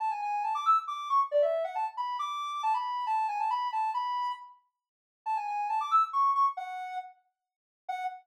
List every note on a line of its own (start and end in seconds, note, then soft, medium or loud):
0.00 0.10 A5 medium
0.11 0.21 G#5 medium
0.22 0.43 G#5 medium
0.44 0.54 A5 medium
0.55 0.65 D6 medium
0.66 0.76 E6 medium
0.87 1.08 D6 medium
1.10 1.20 C#6 medium
1.31 1.42 D5 medium
1.42 1.63 E5 medium
1.64 1.75 F#5 medium
1.75 1.86 A5 medium
1.97 2.17 B5 medium
2.19 2.62 D6 medium
2.63 2.73 A5 medium
2.74 3.05 B5 medium
3.07 3.26 A5 medium
3.28 3.39 G#5 medium
3.40 3.50 A5 medium
3.50 3.68 B5 medium
3.72 3.90 A5 medium
3.94 4.32 B5 medium
5.26 5.36 A5 medium
5.37 5.47 G#5 medium
5.47 5.67 G#5 medium
5.69 5.80 A5 medium
5.80 5.91 D6 medium
5.91 6.02 E6 medium
6.13 6.31 C#6 medium
6.35 6.45 C#6 medium
6.57 6.96 F#5 medium
7.89 8.04 F#5 loud